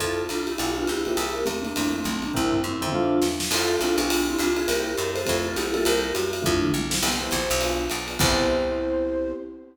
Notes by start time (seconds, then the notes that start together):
0.00 F2 C4 E4 F4 A4, kick, ride
0.29 C2 D4 F4, hi-hat pedal, ride
0.47 E4 G4, ride
0.58 B1 B3 F4 G4 G#4, ride
0.76 B3 D4 F4 G4 G#4
0.87 C#2 E4 G4, hi-hat pedal, ride
1.05 A#3 C4 E4 F4 G4 G#4, ride
1.17 C2 G4 A#4, ride
1.46 E2 A3 C4, hi-hat pedal, ride
1.62 A#3 D4, ride
1.76 F2 A3 C4 E4 F4, kick, ride
1.92 A3 C4
2.04 B1 A3 C4, kick, hi-hat pedal, ride
2.22 A#3 D4, ride
2.34 C2 C4 E4 A#4 C5 E5 G5, kick, floor tom
2.52 floor tom
2.64 F#2 C4 E4
2.81 F2 A#4 C5 E5 G5, mid tom
2.92 D4 F4 A4 C5 E5 F5, high tom
3.22 E2, snare
3.40 snare
3.51 F2 C4 E4 F4 A4, crash, ride
3.80 C2 C4 D4 E4 F4 A4, hi-hat pedal, ride
3.98 B1 B3 D4 F4 G4 G#4, ride
4.10 ride
4.30 C4 E4
4.39 C#2 D4 F4, hi-hat pedal, ride
4.56 F4 G#4, ride
4.67 C2 A#3 C4 E4 G4 A#4, ride
4.97 F#2 G4 A#4, hi-hat pedal, ride
5.15 A4 C5, ride
5.25 F2 A3 C4 E4 F4, kick, ride
5.46 F4 A4
5.56 B1 E4 G4, hi-hat pedal, ride
5.73 G3 A#3 C4 E4 F4 A4, ride
5.85 C2 G4 A#4, ride
6.14 F#2 F#4, hi-hat pedal, ride
6.33 ride
6.42 F2 A3 C4 D4 E4 F4, kick, floor tom
6.62 mid tom
6.74 B1, high tom
6.90 A3 C4 E4 F4, snare
7.02 C2 B3 C4 E4 G4 C5, crash, ride
7.21 B3 C4 E4 G4
7.31 A#1, kick, hi-hat pedal, ride
7.50 B1, ride
7.61 B3 D4 F4 G#4, ride
7.90 B1, hi-hat pedal, ride
8.08 B3 D4 F4 G#4, ride
8.19 C2 B3 C4 E4 G4 C5, kick, crash